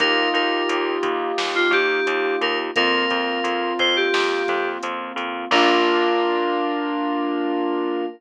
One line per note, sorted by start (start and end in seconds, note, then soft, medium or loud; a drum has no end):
0.00 0.28 D#2 medium
0.00 2.70 A#3 medium
0.00 2.70 D#4 medium
0.00 2.70 F4 medium
0.00 2.70 G4 medium
0.00 0.29 A#4 loud
0.00 kick loud
0.00 closed hi-hat loud
0.34 0.63 D#2 medium
0.34 0.94 A#4 medium
0.34 closed hi-hat medium
0.69 0.98 D#2 medium
0.69 closed hi-hat loud
1.03 1.32 D#2 medium
1.03 kick medium
1.03 closed hi-hat medium
1.38 1.67 D#2 medium
1.38 snare loud
1.55 1.72 F4 medium
1.71 2.00 D#2 medium
1.71 2.35 G4 medium
1.71 kick medium
1.71 closed hi-hat medium
2.07 2.36 D#2 medium
2.07 closed hi-hat loud
2.41 2.71 D#2 medium
2.41 2.58 A#4 medium
2.41 closed hi-hat medium
2.76 3.06 F2 medium
2.76 5.46 A#3 medium
2.76 5.46 C4 medium
2.76 5.46 F4 medium
2.76 3.72 A#4 loud
2.76 kick loud
2.76 closed hi-hat loud
3.10 3.40 F2 medium
3.10 kick medium
3.10 closed hi-hat medium
3.44 3.73 F2 medium
3.44 closed hi-hat loud
3.79 4.08 F2 medium
3.79 3.96 C5 medium
3.79 kick medium
3.79 closed hi-hat medium
3.96 4.69 G4 medium
4.14 4.43 F2 medium
4.14 snare loud
4.48 4.78 F2 medium
4.48 kick medium
4.48 closed hi-hat medium
4.83 5.12 F2 medium
4.83 closed hi-hat loud
5.16 5.45 F2 medium
5.16 closed hi-hat medium
5.51 8.04 A#1 loud
5.51 8.06 A#3 loud
5.51 8.06 D4 loud
5.51 8.06 F4 loud
5.51 8.05 A#4 loud
5.51 kick loud
5.51 crash loud